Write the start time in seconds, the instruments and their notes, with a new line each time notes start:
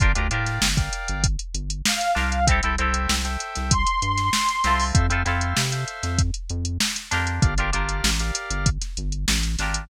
0.00 synth bass 1 G1, acoustic guitar (steel) D4 F4 G4 A#4, drawbar organ A#4 D5 F5 G5, kick, closed hi-hat
0.15 synth bass 1 D2, acoustic guitar (steel) D4 F4 G4 A#4, drawbar organ A#4 D5 F5 G5, closed hi-hat
0.31 synth bass 1 A2, acoustic guitar (steel) D4 F4 G4 A#4, drawbar organ A#4 D5 F5 G5, closed hi-hat
0.46 snare, closed hi-hat
0.61 synth bass 1 G1, snare
0.77 drawbar organ A#4 D5 F5 G5, kick, closed hi-hat
0.93 closed hi-hat
1.08 synth bass 1 G1, closed hi-hat
1.24 kick, closed hi-hat
1.39 closed hi-hat
1.54 synth bass 1 G1, closed hi-hat
1.70 closed hi-hat
1.85 lead 2 (sawtooth) F5, snare
2.01 closed hi-hat
2.15 synth bass 1 C2, acoustic guitar (steel) D4 F4 G4 A#4, snare
2.32 closed hi-hat
2.47 acoustic guitar (steel) C4 E4 G4, drawbar organ A4 C5 E5 G5, kick, closed hi-hat
2.52 acoustic guitar (steel) A4
2.63 synth bass 1 C2, acoustic guitar (steel) C4 E4 G4 A4, drawbar organ A4 C5 E5 G5, closed hi-hat
2.78 synth bass 1 C2, acoustic guitar (steel) C4 E4 G4 A4, drawbar organ A4 C5 E5 G5, closed hi-hat
2.94 closed hi-hat
3.09 synth bass 1 C2, snare
3.25 drawbar organ A4 C5 E5 G5, closed hi-hat
3.40 closed hi-hat
3.55 synth bass 1 C2, snare, closed hi-hat
3.71 lead 2 (sawtooth) C6, kick, closed hi-hat
3.87 closed hi-hat
4.02 synth bass 1 G2, closed hi-hat
4.17 snare, closed hi-hat
4.33 snare
4.49 closed hi-hat
4.64 synth bass 1 C2, acoustic guitar (steel) C4 E4 F4 A4, snare, closed hi-hat
4.80 open hi-hat
4.94 synth bass 1 F2, drawbar organ A4 C5 E5 F5, kick, closed hi-hat
5.10 synth bass 1 F2, acoustic guitar (steel) C4 E4 F4 A4, drawbar organ A4 C5 E5 F5, closed hi-hat
5.25 synth bass 1 F2, acoustic guitar (steel) C4 E4 F4 A4, drawbar organ A4 C5 E5 F5, snare, closed hi-hat
5.41 closed hi-hat
5.57 synth bass 1 C3, snare
5.72 drawbar organ A4 C5 E5 F5, closed hi-hat
5.88 closed hi-hat
6.03 synth bass 1 F2, snare, closed hi-hat
6.19 kick, closed hi-hat
6.34 closed hi-hat
6.49 synth bass 1 F2, closed hi-hat
6.65 closed hi-hat
6.80 snare
6.96 snare, closed hi-hat
7.11 synth bass 1 F2, acoustic guitar (steel) D4 F4 G4 A#4, snare, closed hi-hat
7.27 closed hi-hat
7.42 synth bass 1 G1, drawbar organ G4 A#4 D5 F5, kick, closed hi-hat
7.58 synth bass 1 G1, acoustic guitar (steel) D4 F4 G4 A#4, drawbar organ G4 A#4 D5 F5, closed hi-hat
7.73 synth bass 1 G1, acoustic guitar (steel) D4 F4 G4 A#4, drawbar organ G4 A#4 D5 F5, closed hi-hat
7.89 closed hi-hat
8.04 synth bass 1 A1, snare
8.19 drawbar organ G4 A#4 D5 F5, closed hi-hat
8.35 closed hi-hat
8.51 synth bass 1 G1, closed hi-hat
8.66 kick, closed hi-hat
8.81 snare, closed hi-hat
8.97 synth bass 1 G1, closed hi-hat
9.12 closed hi-hat
9.28 synth bass 1 A1, snare
9.43 closed hi-hat
9.59 synth bass 1 G#1, acoustic guitar (steel) D4 F4 G4 A#4, snare, closed hi-hat
9.74 closed hi-hat